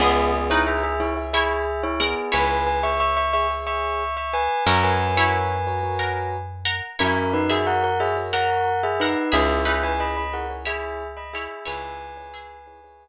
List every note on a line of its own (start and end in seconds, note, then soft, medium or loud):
0.00 2.15 C#2 loud
0.00 0.31 B3 medium
0.00 0.48 B3 medium
0.00 0.31 G#4 loud
0.00 0.40 G#4 medium
0.00 0.48 G#4 loud
0.00 0.40 C#5 medium
0.00 0.40 E5 medium
0.33 0.49 B3 medium
0.33 0.49 G#4 medium
0.50 0.94 D#4 medium
0.50 0.66 E4 medium
0.50 0.90 G#4 medium
0.50 0.94 B4 loud
0.50 0.90 C#5 medium
0.50 0.66 C#5 medium
0.50 0.90 E5 medium
0.67 0.83 G#4 medium
0.67 0.83 E5 medium
0.83 0.99 G#4 medium
0.83 0.99 E5 medium
1.00 1.16 E4 medium
1.00 1.13 G#4 medium
1.00 1.13 C#5 medium
1.00 1.16 C#5 medium
1.00 1.13 E5 medium
1.17 1.70 G#4 medium
1.17 1.70 C#5 medium
1.17 1.70 E5 medium
1.33 1.64 E4 medium
1.33 1.82 G#4 medium
1.33 1.64 C#5 loud
1.33 1.82 E5 medium
1.83 1.99 E4 medium
1.83 1.99 C#5 medium
2.00 2.29 B3 medium
2.00 2.29 G#4 medium
2.00 2.30 A#4 medium
2.00 2.30 F#5 loud
2.32 4.48 C#2 medium
2.32 3.20 E4 loud
2.32 2.63 B4 medium
2.32 3.20 C#5 loud
2.32 2.63 G#5 medium
2.67 2.83 B4 medium
2.67 2.83 G#5 medium
2.83 3.23 G#4 medium
2.83 3.23 C#5 medium
2.83 3.23 E5 medium
2.83 2.99 E5 medium
2.83 2.99 C#6 medium
3.00 3.16 E5 medium
3.00 3.16 C#6 medium
3.17 3.33 E5 medium
3.17 3.33 C#6 medium
3.33 3.47 G#4 medium
3.33 3.47 C#5 medium
3.33 3.49 E5 medium
3.33 3.47 E5 medium
3.33 3.49 C#6 medium
3.50 4.03 G#4 medium
3.50 4.03 C#5 medium
3.50 4.03 E5 medium
3.67 4.14 E5 medium
3.67 4.14 C#6 medium
4.17 4.33 E5 medium
4.17 4.33 C#6 medium
4.33 4.63 B4 medium
4.33 4.63 G#5 medium
4.67 6.81 F#2 loud
4.67 5.13 C#4 loud
4.67 5.07 F#4 medium
4.67 5.13 A#4 loud
4.67 5.07 A#4 medium
4.67 4.83 C#5 medium
4.67 5.07 C#5 medium
4.67 4.83 A#5 medium
4.83 6.35 B4 medium
4.83 6.35 G#5 medium
5.17 5.58 E4 loud
5.17 5.57 F#4 medium
5.17 5.57 A#4 medium
5.17 5.57 C#5 medium
5.17 5.58 C#5 loud
5.67 5.80 F#4 medium
5.67 5.80 A#4 medium
5.67 5.80 C#5 medium
5.83 6.37 F#4 medium
5.83 6.37 A#4 medium
5.83 6.37 C#5 medium
5.99 6.29 A#4 medium
5.99 6.29 F#5 medium
6.65 6.96 A#4 medium
6.65 6.96 F#5 loud
6.99 9.15 F#2 medium
6.99 7.32 C#4 medium
6.99 7.42 E4 loud
6.99 7.32 A#4 medium
6.99 7.42 C#5 loud
7.33 7.49 D#4 medium
7.33 7.49 B4 medium
7.50 7.90 F#4 medium
7.50 7.96 G#4 medium
7.50 7.66 G#4 medium
7.50 7.90 A#4 medium
7.50 7.90 C#5 medium
7.50 7.96 E5 medium
7.50 7.66 E5 medium
7.67 7.83 A#4 medium
7.67 7.83 F#5 medium
7.83 7.99 A#4 medium
7.83 7.99 F#5 medium
8.00 8.13 F#4 medium
8.00 8.16 G#4 medium
8.00 8.13 A#4 medium
8.00 8.13 C#5 medium
8.00 8.16 E5 medium
8.16 8.70 F#4 medium
8.16 8.70 A#4 medium
8.16 8.70 C#5 medium
8.33 8.62 A#4 medium
8.33 8.81 A#4 medium
8.33 8.62 F#5 medium
8.33 8.81 F#5 medium
8.83 8.99 G#4 medium
8.83 8.99 E5 medium
9.00 9.33 D#4 medium
9.00 9.28 A#4 medium
9.00 9.33 B4 medium
9.00 9.28 F#5 medium
9.32 11.48 C#2 loud
9.32 9.73 E4 medium
9.32 9.60 G#4 loud
9.32 9.61 G#4 medium
9.32 9.73 G#4 medium
9.32 9.73 C#5 medium
9.32 9.60 E5 loud
9.32 9.61 E5 medium
9.65 10.57 D#4 medium
9.65 9.83 G#4 medium
9.65 10.57 B4 loud
9.65 9.83 E5 medium
9.83 10.24 E4 medium
9.83 10.24 G#4 medium
9.83 9.99 B4 medium
9.83 10.24 C#5 medium
9.83 9.99 G#5 medium
10.00 10.16 D#5 medium
10.00 10.16 B5 medium
10.17 10.33 D#5 medium
10.17 10.33 B5 medium
10.33 10.47 E4 medium
10.33 10.47 G#4 medium
10.33 10.49 A#4 medium
10.33 10.47 C#5 medium
10.33 10.49 F#5 medium
10.50 11.03 E4 medium
10.50 11.03 G#4 medium
10.50 11.03 C#5 medium
10.65 11.13 E4 medium
10.65 11.07 G#4 medium
10.65 11.13 C#5 loud
10.65 11.07 E5 medium
11.17 11.33 D#5 medium
11.17 11.33 B5 medium
11.33 11.65 E4 medium
11.33 11.64 G#4 medium
11.33 11.65 C#5 loud
11.33 11.64 E5 medium
11.65 13.08 C#2 medium
11.65 12.25 E4 loud
11.65 13.08 B4 medium
11.65 12.25 C#5 loud
11.65 13.08 G#5 medium
12.17 12.57 E4 medium
12.17 12.57 G#4 medium
12.17 12.57 C#5 medium
12.34 12.97 G#4 medium
12.34 12.97 E5 medium
12.67 12.80 E4 medium
12.67 12.80 G#4 medium
12.67 12.80 C#5 medium
12.84 13.08 E4 medium
12.84 13.08 G#4 medium
12.84 13.08 C#5 medium